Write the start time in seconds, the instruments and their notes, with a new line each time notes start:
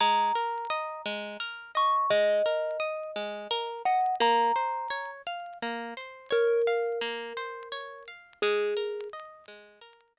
0.00 orchestral harp G#3, kalimba A#5
0.35 orchestral harp A#4
0.70 orchestral harp D#5
1.06 orchestral harp G#3
1.40 orchestral harp A#4
1.75 orchestral harp D#5, kalimba C#6
2.10 orchestral harp G#3, kalimba D#5
2.46 orchestral harp A#4
2.80 orchestral harp D#5
3.16 orchestral harp G#3
3.51 orchestral harp A#4
3.85 orchestral harp D#5, kalimba F#5
4.20 orchestral harp A#3, kalimba A#5
4.56 orchestral harp C5
4.90 orchestral harp C#5
5.27 orchestral harp F5
5.62 orchestral harp A#3
5.97 orchestral harp C5
6.31 kalimba A#4, orchestral harp C#5
6.67 orchestral harp F5
7.01 orchestral harp A#3
7.37 orchestral harp C5
7.72 orchestral harp C#5
8.08 orchestral harp F5
8.42 orchestral harp G#3, kalimba G#4
8.77 orchestral harp A#4
9.13 orchestral harp D#5
9.48 orchestral harp G#3
9.81 orchestral harp A#4
10.17 orchestral harp D#5